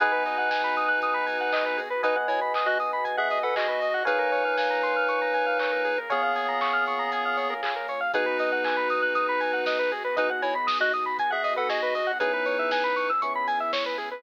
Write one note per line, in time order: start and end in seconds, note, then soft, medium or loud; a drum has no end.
0.00 1.87 G#1 medium
0.00 4.03 B3 medium
0.00 4.03 D#4 medium
0.00 1.81 D#4 medium
0.00 4.03 F#4 medium
0.00 4.03 G#4 loud
0.00 0.12 G#4 medium
0.00 1.83 B4 loud
0.00 1.81 B4 medium
0.00 1.83 D#5 medium
0.00 1.83 F#5 loud
0.00 1.83 G#5 loud
0.00 kick loud
0.00 closed hi-hat loud
0.12 0.23 B4 medium
0.25 0.37 D#5 medium
0.25 open hi-hat medium
0.38 0.49 F#5 medium
0.50 0.62 G#5 medium
0.50 kick medium
0.50 snare loud
0.64 0.75 B5 medium
0.76 0.88 D#6 medium
0.76 open hi-hat medium
0.88 1.00 F#6 medium
1.02 1.14 D#6 medium
1.02 kick medium
1.02 closed hi-hat loud
1.14 1.25 B5 medium
1.26 1.38 G#5 medium
1.26 open hi-hat medium
1.41 1.52 F#5 medium
1.53 1.64 D#5 medium
1.53 kick loud
1.53 clap loud
1.65 1.77 B4 medium
1.77 1.89 G#4 medium
1.77 open hi-hat medium
1.90 2.02 B4 medium
2.03 3.90 G#1 medium
2.03 2.16 D#4 medium
2.03 3.86 B4 loud
2.03 2.16 B4 medium
2.03 3.86 D#5 loud
2.03 2.15 D#5 medium
2.03 3.86 F#5 medium
2.03 3.86 G#5 loud
2.03 kick loud
2.03 closed hi-hat loud
2.16 2.27 F#5 medium
2.28 2.40 E4 medium
2.28 2.40 C#5 medium
2.28 2.40 G#5 medium
2.28 open hi-hat medium
2.41 2.53 B5 medium
2.54 2.66 D#6 medium
2.54 kick medium
2.54 clap loud
2.66 2.78 F#4 medium
2.66 2.78 D#5 medium
2.66 2.78 F#6 medium
2.80 2.91 D#6 medium
2.80 open hi-hat medium
2.93 3.04 B5 medium
3.05 3.16 G#5 medium
3.05 kick loud
3.05 closed hi-hat loud
3.17 3.39 G#4 medium
3.17 3.39 E5 medium
3.17 3.29 F#5 medium
3.30 3.42 D#5 medium
3.30 open hi-hat medium
3.43 3.55 A4 medium
3.43 3.55 B4 medium
3.43 3.55 F#5 medium
3.56 4.03 F#4 medium
3.56 3.67 G#4 medium
3.56 4.03 D#5 medium
3.56 kick loud
3.56 clap loud
3.68 3.79 B4 medium
3.81 3.93 D#5 medium
3.81 open hi-hat medium
3.94 4.05 F#5 medium
4.05 5.94 A#1 medium
4.05 8.09 A#3 medium
4.05 8.09 C#4 medium
4.05 5.99 D#4 medium
4.05 8.09 F4 medium
4.05 8.09 G#4 medium
4.05 4.19 G#4 medium
4.05 5.88 A#4 loud
4.05 5.99 B4 medium
4.05 5.88 C#5 loud
4.05 5.88 F5 loud
4.05 5.88 G#5 loud
4.05 kick loud
4.05 closed hi-hat loud
4.19 4.30 A#4 medium
4.32 4.43 C#5 medium
4.32 open hi-hat medium
4.45 4.56 F5 medium
4.57 4.69 G#5 medium
4.57 kick loud
4.57 snare loud
4.70 4.82 A#5 medium
4.83 4.95 C6 medium
4.83 open hi-hat medium
4.96 5.08 F6 medium
5.08 5.20 C#6 medium
5.08 kick medium
5.08 closed hi-hat loud
5.22 5.33 A#5 medium
5.34 5.45 G#5 medium
5.34 open hi-hat medium
5.46 5.58 F5 medium
5.59 5.71 C#5 medium
5.59 kick medium
5.59 clap loud
5.72 5.83 A#4 medium
5.85 5.96 G#4 medium
5.85 open hi-hat medium
5.98 6.09 A#4 medium
6.09 7.97 A#1 medium
6.09 7.54 B3 medium
6.09 7.54 G#4 medium
6.09 7.92 A#4 medium
6.09 7.92 C#5 medium
6.09 6.22 C#5 medium
6.09 7.92 F5 loud
6.09 7.92 G#5 loud
6.09 kick loud
6.09 closed hi-hat loud
6.23 6.34 F5 medium
6.35 6.47 G#5 medium
6.35 open hi-hat loud
6.48 6.60 A#5 medium
6.61 6.73 C#6 medium
6.61 kick loud
6.61 clap loud
6.73 6.85 F6 medium
6.86 6.99 C#6 medium
6.86 open hi-hat medium
6.99 7.10 A#5 medium
7.12 7.24 G#5 medium
7.12 kick medium
7.12 closed hi-hat loud
7.25 7.37 F5 medium
7.37 7.49 C#5 medium
7.37 open hi-hat medium
7.50 7.61 A#4 medium
7.63 7.74 G#4 medium
7.63 kick medium
7.63 clap loud
7.76 7.87 A#4 medium
7.88 8.00 C#5 medium
7.88 open hi-hat medium
8.01 8.12 F5 medium
8.14 10.01 G#1 medium
8.14 12.17 B3 loud
8.14 9.97 B3 loud
8.14 12.17 D#4 medium
8.14 9.97 D#4 loud
8.14 9.92 D#4 medium
8.14 12.17 F#4 loud
8.14 9.97 F#4 loud
8.14 12.17 G#4 medium
8.14 9.97 G#4 loud
8.14 8.26 G#4 loud
8.14 9.92 B4 medium
8.14 kick loud
8.14 closed hi-hat loud
8.26 8.37 B4 medium
8.39 8.51 D#5 medium
8.39 open hi-hat loud
8.52 8.64 F#5 medium
8.64 8.76 G#5 medium
8.64 kick loud
8.64 clap loud
8.77 8.88 B5 medium
8.90 9.01 D#6 medium
8.90 open hi-hat medium
9.02 9.14 F#6 medium
9.15 9.26 D#6 medium
9.15 kick loud
9.15 closed hi-hat loud
9.29 9.40 B5 medium
9.40 9.52 G#5 medium
9.40 open hi-hat medium
9.53 9.65 F#5 medium
9.66 9.78 D#5 medium
9.66 kick loud
9.66 snare loud
9.79 9.90 B4 medium
9.92 10.03 G#4 medium
9.92 open hi-hat medium
10.04 10.16 B4 medium
10.16 12.04 G#1 medium
10.16 12.01 B3 loud
10.16 12.01 D#4 loud
10.16 10.30 D#4 medium
10.16 12.01 F#4 medium
10.16 12.01 G#4 loud
10.16 10.30 B4 medium
10.16 10.28 D#5 medium
10.16 kick loud
10.16 closed hi-hat loud
10.30 10.41 F#5 medium
10.42 10.54 E4 medium
10.42 10.54 C#5 medium
10.42 10.53 G#5 medium
10.42 open hi-hat medium
10.55 10.66 B5 medium
10.67 10.78 D#6 medium
10.67 kick loud
10.67 snare loud
10.80 10.92 F#4 medium
10.80 10.92 D#5 medium
10.80 10.92 F#6 medium
10.93 11.05 D#6 medium
10.93 open hi-hat loud
11.06 11.17 B5 medium
11.19 11.31 G#5 medium
11.19 kick loud
11.19 closed hi-hat loud
11.31 11.54 G#4 medium
11.31 11.54 E5 medium
11.31 11.42 F#5 medium
11.44 11.55 D#5 medium
11.44 open hi-hat loud
11.56 11.69 A4 medium
11.56 11.68 B4 medium
11.56 11.69 F#5 medium
11.69 12.12 F#4 medium
11.69 11.81 G#4 medium
11.69 12.12 D#5 medium
11.69 kick loud
11.69 snare loud
11.82 11.94 B4 medium
11.95 12.06 D#5 medium
11.95 open hi-hat loud
12.07 12.18 F#5 medium
12.20 13.14 C#2 medium
12.20 14.22 B3 medium
12.20 13.12 B3 loud
12.20 14.22 C#4 medium
12.20 13.12 C#4 loud
12.20 13.11 D#4 medium
12.20 14.22 E4 loud
12.20 13.12 E4 loud
12.20 14.22 G#4 medium
12.20 13.12 G#4 loud
12.20 12.32 G#4 medium
12.20 13.11 B4 medium
12.20 kick loud
12.20 closed hi-hat loud
12.33 12.45 B4 medium
12.46 12.57 C#5 medium
12.46 open hi-hat medium
12.59 12.70 E5 medium
12.71 12.83 G#5 medium
12.71 kick loud
12.71 snare loud
12.84 12.95 B5 medium
12.96 13.08 C#6 medium
12.96 open hi-hat medium
13.10 13.21 E6 medium
13.22 14.16 C#2 medium
13.22 14.14 B3 medium
13.22 14.14 C#4 loud
13.22 14.14 E4 loud
13.22 14.14 G#4 medium
13.22 13.33 C#6 medium
13.22 kick medium
13.22 closed hi-hat loud
13.35 13.47 B5 medium
13.47 13.59 G#5 medium
13.47 open hi-hat loud
13.60 13.72 E5 medium
13.73 13.84 C#5 medium
13.73 kick loud
13.73 snare loud
13.86 13.97 B4 medium
13.98 14.09 G#4 medium
13.98 open hi-hat medium
14.11 14.22 B4 medium